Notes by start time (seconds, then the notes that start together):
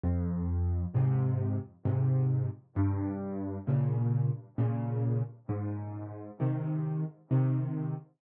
0.04 F2
0.95 G#2 C3
1.85 G#2 C3
2.76 G2
3.67 A#2 C#3
4.58 A#2 C#3
5.49 G#2
6.40 C3 D#3
7.31 C3 D#3